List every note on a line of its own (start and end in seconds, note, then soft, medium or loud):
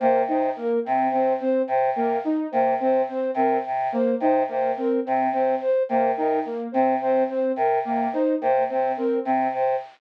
0.00 0.23 C3 medium
0.00 0.23 A#3 medium
0.00 0.22 C5 medium
0.27 0.49 C3 medium
0.27 0.51 D#4 medium
0.27 0.50 C5 medium
0.56 0.79 A#3 medium
0.56 0.80 A#4 medium
0.85 1.09 C3 medium
0.85 1.07 C4 medium
1.11 1.33 C3 medium
1.11 1.35 C4 medium
1.11 1.33 C5 medium
1.40 1.63 C4 medium
1.40 1.62 C5 medium
1.68 1.90 C3 medium
1.68 1.90 C5 medium
1.94 2.17 C3 medium
1.94 2.18 A#3 medium
1.94 2.19 A#4 medium
2.24 2.47 D#4 medium
2.51 2.75 C3 medium
2.51 2.75 A#3 medium
2.51 2.74 C5 medium
2.79 3.03 C3 medium
2.79 3.02 C4 medium
2.79 3.02 C5 medium
3.08 3.31 C4 medium
3.08 3.31 C5 medium
3.34 3.57 C3 medium
3.34 3.59 C4 medium
3.34 3.58 A#4 medium
3.66 3.88 C3 medium
3.92 4.15 A#3 medium
3.92 4.15 C5 medium
4.20 4.43 C3 medium
4.20 4.43 D#4 medium
4.20 4.43 C5 medium
4.48 4.72 C3 medium
4.48 4.71 A#3 medium
4.48 4.72 C5 medium
4.77 4.99 C4 medium
4.77 5.00 A#4 medium
5.05 5.29 C3 medium
5.05 5.27 C4 medium
5.32 5.54 C3 medium
5.32 5.55 C4 medium
5.32 5.55 C5 medium
5.61 5.83 C5 medium
5.88 6.12 C3 medium
5.88 6.12 A#3 medium
5.88 6.11 C5 medium
6.16 6.40 C3 medium
6.16 6.40 D#4 medium
6.16 6.39 A#4 medium
6.45 6.68 A#3 medium
6.72 6.96 C3 medium
6.72 6.96 C4 medium
6.72 6.94 C5 medium
7.00 7.23 C3 medium
7.00 7.23 C4 medium
7.00 7.23 C5 medium
7.29 7.52 C4 medium
7.29 7.52 C5 medium
7.56 7.79 C3 medium
7.56 7.79 A#4 medium
7.85 8.08 C3 medium
7.85 8.07 A#3 medium
8.13 8.36 D#4 medium
8.13 8.35 C5 medium
8.41 8.64 C3 medium
8.41 8.63 A#3 medium
8.41 8.64 C5 medium
8.69 8.93 C3 medium
8.69 8.91 C4 medium
8.69 8.92 C5 medium
8.97 9.20 C4 medium
8.97 9.19 A#4 medium
9.25 9.48 C3 medium
9.25 9.48 C4 medium
9.52 9.74 C3 medium
9.52 9.76 C5 medium